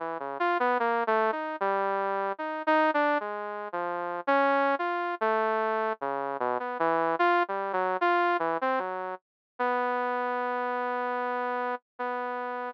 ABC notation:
X:1
M:4/4
L:1/16
Q:1/4=75
K:none
V:1 name="Lead 2 (sawtooth)"
E, _D, F B, (3_B,2 A,2 _E2 G,4 (3E2 E2 =D2 | (3_A,4 F,4 _D4 F2 =A,4 _D,2 | B,, B, E,2 (3F2 G,2 _G,2 F2 E, C G,2 z2 | B,12 B,4 |]